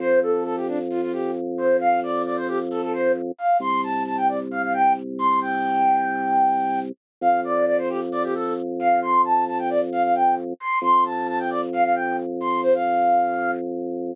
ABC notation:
X:1
M:4/4
L:1/16
Q:1/4=133
K:Flyd
V:1 name="Flute"
c2 A2 A G D z F F G2 z2 c2 | f2 d2 d c G z A A c2 z2 f2 | c'2 a2 a g d z f f g2 z2 c'2 | g14 z2 |
f2 d2 d c G z d G A2 z2 f2 | c'2 a2 a g d z f f g2 z2 c'2 | c'2 a2 a g d z f f g2 z2 c'2 | c f7 z8 |]
V:2 name="Drawbar Organ" clef=bass
F,,16- | F,,16 | C,,16- | C,,16 |
F,,16- | F,,16 | F,,16- | F,,16 |]